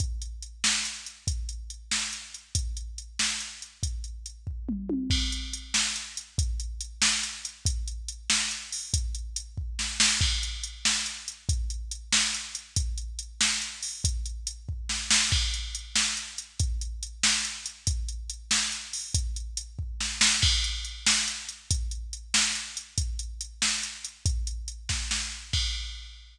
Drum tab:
CC |------|------|------|------|
HH |xxx-xx|xxx-xx|xxx-xx|xxx---|
SD |---o--|---o--|---o--|------|
T1 |------|------|------|-----o|
T2 |------|------|------|----o-|
BD |o-----|o-----|o-----|o--o--|

CC |x-----|------|------|------|
HH |-xx-xx|xxx-xx|xxx-xo|xxx---|
SD |---o--|---o--|---o--|----oo|
T1 |------|------|------|------|
T2 |------|------|------|------|
BD |o-----|o-----|o-----|o--o--|

CC |x-----|------|------|------|
HH |-xx-xx|xxx-xx|xxx-xo|xxx---|
SD |---o--|---o--|---o--|----oo|
T1 |------|------|------|------|
T2 |------|------|------|------|
BD |o-----|o-----|o-----|o--o--|

CC |x-----|------|------|------|
HH |-xx-xx|xxx-xx|xxx-xo|xxx---|
SD |---o--|---o--|---o--|----oo|
T1 |------|------|------|------|
T2 |------|------|------|------|
BD |o-----|o-----|o-----|o--o--|

CC |x-----|------|------|------|
HH |-xx-xx|xxx-xx|xxx-xx|xxx---|
SD |---o--|---o--|---o--|---oo-|
T1 |------|------|------|------|
T2 |------|------|------|------|
BD |o-----|o-----|o-----|o--o--|

CC |x-----|
HH |------|
SD |------|
T1 |------|
T2 |------|
BD |o-----|